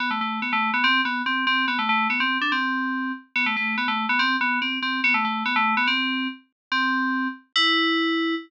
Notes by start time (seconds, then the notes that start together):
0.00 B3
0.11 A3
0.21 A3
0.42 B3
0.53 A3
0.74 B3
0.84 C4
1.05 B3
1.26 C4
1.47 C4
1.68 B3
1.79 A3
1.89 A3
2.10 B3
2.20 C4
2.41 D4
2.52 C4
3.36 B3
3.46 A3
3.56 A3
3.78 B3
3.88 A3
4.09 B3
4.19 C4
4.41 B3
4.62 C4
4.82 C4
5.04 B3
5.14 A3
5.25 A3
5.46 B3
5.56 A3
5.77 B3
5.87 C4
6.72 C4
7.56 E4